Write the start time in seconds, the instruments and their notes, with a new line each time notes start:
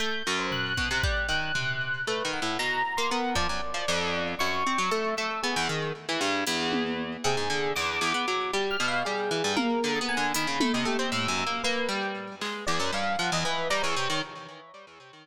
0.00 orchestral harp A3, electric piano 1 G6
0.27 orchestral harp F#2
0.39 electric piano 1 C5
0.52 electric piano 1 F#6, floor tom
0.77 orchestral harp B2, kick
0.91 orchestral harp C3
1.03 orchestral harp G3, kick
1.29 orchestral harp D#3, electric piano 1 F#6
1.55 orchestral harp C3, floor tom
2.07 orchestral harp A3, electric piano 1 B4
2.25 orchestral harp D#3
2.33 electric piano 1 F#5, cowbell
2.42 orchestral harp A2
2.59 orchestral harp B2, electric piano 1 A#5
2.97 orchestral harp A#3, electric piano 1 C6
3.10 orchestral harp B3, electric piano 1 A#4
3.35 orchestral harp F3, electric piano 1 D5, kick
3.49 orchestral harp F#2
3.74 orchestral harp F3, electric piano 1 D5
3.88 orchestral harp F2, electric piano 1 D5
4.39 orchestral harp F#2, electric piano 1 C#6
4.67 orchestral harp C4
4.78 orchestral harp F#3
4.91 orchestral harp A3, closed hi-hat
5.17 orchestral harp A3, electric piano 1 E6
5.43 orchestral harp B3, electric piano 1 G#4
5.56 orchestral harp E2
5.69 orchestral harp D#3
6.09 orchestral harp E3
6.21 orchestral harp G2
6.47 orchestral harp E2, closed hi-hat
6.72 high tom
7.24 orchestral harp C3, electric piano 1 G#4
7.37 orchestral harp G#2
7.50 orchestral harp D3
7.76 orchestral harp E2, electric piano 1 D6
8.01 orchestral harp E2
8.14 orchestral harp B3
8.28 orchestral harp F#3
8.53 orchestral harp G3, electric piano 1 G4
8.71 electric piano 1 F6
8.80 orchestral harp B2
8.88 electric piano 1 F5
9.05 orchestral harp G3, electric piano 1 G#4
9.31 orchestral harp E3
9.44 orchestral harp G2
9.56 orchestral harp A#3, electric piano 1 A#4, high tom
9.84 orchestral harp D3
9.95 electric piano 1 D#6
10.01 orchestral harp B3
10.09 electric piano 1 G#5
10.17 orchestral harp D3
10.34 orchestral harp D#3, electric piano 1 B5, closed hi-hat
10.47 orchestral harp C#3
10.60 orchestral harp A3, high tom
10.73 orchestral harp C3, electric piano 1 D#5
10.85 orchestral harp A3, electric piano 1 G4
10.99 orchestral harp C4
11.12 orchestral harp A2, electric piano 1 E6
11.28 orchestral harp F#2
11.38 cowbell
11.47 orchestral harp A#3
11.64 orchestral harp A#3, electric piano 1 B4
11.89 orchestral harp G3
12.41 orchestral harp G#3, clap
12.67 orchestral harp E2, electric piano 1 D5
12.80 orchestral harp F#2
12.93 orchestral harp G2, electric piano 1 F5, cowbell
13.19 orchestral harp F3, electric piano 1 F#5
13.32 orchestral harp E2, electric piano 1 D#5
13.45 orchestral harp E3, electric piano 1 B4
13.70 orchestral harp G3, electric piano 1 A#5
13.83 orchestral harp E2, electric piano 1 C#5
13.96 orchestral harp C3
14.10 orchestral harp D#3